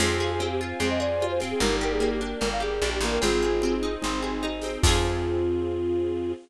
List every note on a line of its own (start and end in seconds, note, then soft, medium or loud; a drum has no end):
0.00 0.73 F2 loud
0.00 0.40 C4 loud
0.00 0.49 F4 loud
0.00 0.17 G#4 loud
0.00 0.49 G#4 loud
0.00 1.59 C5 medium
0.00 1.59 F5 medium
0.00 1.59 G#5 medium
0.00 crash medium
0.00 cowbell medium
0.00 low conga medium
0.20 0.99 G#4 medium
0.20 0.30 G#4 medium
0.20 high conga medium
0.32 0.48 G#4 medium
0.39 0.80 C4 medium
0.39 cowbell medium
0.39 high conga medium
0.51 0.60 G4 loud
0.61 1.22 F4 medium
0.79 1.54 F2 medium
0.79 1.41 C4 loud
0.79 0.89 G#4 loud
0.79 cowbell medium
0.79 low conga medium
0.90 1.00 D#5 medium
1.00 1.57 G#4 medium
1.00 1.26 D5 loud
1.20 1.60 F4 medium
1.20 cowbell medium
1.20 high conga medium
1.30 1.40 C5 loud
1.40 1.61 C4 medium
1.40 snare soft
1.40 high conga medium
1.51 1.60 G#4 medium
1.60 2.34 G1 medium
1.60 2.00 A#3 loud
1.60 2.18 D#4 loud
1.60 2.18 G4 loud
1.60 1.76 A#4 loud
1.60 3.21 A#4 medium
1.60 3.21 D5 loud
1.60 3.21 G5 medium
1.60 cowbell medium
1.60 low conga medium
1.81 2.60 G4 medium
1.81 1.93 A#4 medium
1.92 2.10 G#4 loud
2.00 2.40 A#3 medium
2.00 cowbell medium
2.00 high conga medium
2.12 2.21 G4 loud
2.21 2.82 D4 medium
2.21 high conga medium
2.40 2.80 G1 medium
2.40 3.02 A#3 medium
2.40 2.49 A#4 medium
2.40 cowbell medium
2.40 low conga medium
2.52 2.62 F5 medium
2.60 3.18 G4 medium
2.60 2.90 G#4 medium
2.82 3.00 A#1 medium
2.82 3.20 D4 medium
2.82 cowbell medium
2.82 high conga medium
2.94 3.04 G4 medium
3.01 3.19 A1 medium
3.01 3.22 A#3 medium
3.01 snare soft
3.01 high conga medium
3.12 3.21 A#4 medium
3.21 3.97 G#1 medium
3.21 3.63 C4 loud
3.21 4.82 C4 medium
3.21 4.82 D#4 medium
3.21 3.75 F4 medium
3.21 3.95 F4 medium
3.21 3.75 G#4 loud
3.21 4.82 G#4 medium
3.21 3.95 G#4 loud
3.21 cowbell medium
3.21 low conga medium
3.43 4.22 G#4 medium
3.43 high conga medium
3.62 4.04 C4 medium
3.62 cowbell medium
3.62 high conga medium
3.83 4.42 D#4 medium
4.02 4.78 G#1 medium
4.02 4.63 C4 medium
4.02 4.20 D#4 loud
4.02 cowbell medium
4.02 low conga medium
4.22 4.80 G#4 medium
4.22 high conga medium
4.42 4.81 D#4 medium
4.42 cowbell medium
4.42 high conga medium
4.61 4.83 C4 medium
4.61 snare soft
4.61 high conga medium
4.82 6.34 F2 loud
4.82 6.33 C4 loud
4.82 6.34 C4 medium
4.82 6.32 F4 loud
4.82 6.33 F4 loud
4.82 6.34 F4 loud
4.82 6.33 G#4 loud
4.82 kick loud
4.82 crash loud
4.87 6.34 G#4 loud